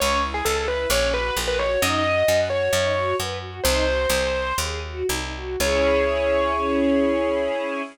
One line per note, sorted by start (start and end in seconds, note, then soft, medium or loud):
0.00 0.42 C#2 loud
0.00 0.20 C#4 medium
0.00 0.21 C#5 loud
0.23 0.43 E4 medium
0.34 0.45 G#4 medium
0.45 0.86 C#2 medium
0.45 0.66 G#4 medium
0.45 0.56 A4 medium
0.56 0.67 A4 medium
0.68 0.88 E4 medium
0.68 0.86 B4 medium
0.90 1.31 A#1 loud
0.90 1.11 C#4 medium
0.90 1.11 C#5 medium
1.14 1.34 F#4 medium
1.14 1.35 B4 medium
1.36 1.77 A#1 medium
1.36 1.57 A#4 medium
1.48 1.58 B4 loud
1.59 1.80 F#4 medium
1.59 1.79 C#5 medium
1.82 2.23 F#2 loud
1.82 2.02 D#4 loud
1.82 2.37 D#5 loud
2.04 2.25 F#4 medium
2.28 2.69 F#2 medium
2.28 2.48 B4 medium
2.50 2.71 F#4 medium
2.50 3.15 C#5 medium
2.72 3.14 F#2 loud
2.72 2.93 D#4 medium
2.95 3.16 F#4 medium
3.18 3.61 F#2 medium
3.18 3.39 B4 medium
3.41 3.61 F#4 medium
3.64 4.06 C2 loud
3.64 3.84 D#4 medium
3.64 4.55 C5 loud
3.87 4.08 F#4 medium
4.09 4.53 C2 loud
4.09 4.31 G#4 medium
4.34 4.56 C5 medium
4.58 5.03 D#2 medium
4.58 4.81 G#4 medium
4.83 5.06 F#4 medium
5.08 5.57 C2 medium
5.08 5.32 D#4 medium
5.35 5.59 F#4 medium
5.60 7.81 C#2 loud
5.60 7.82 C#4 loud
5.60 7.82 E4 loud
5.60 7.82 G#4 loud
5.60 7.81 C#5 loud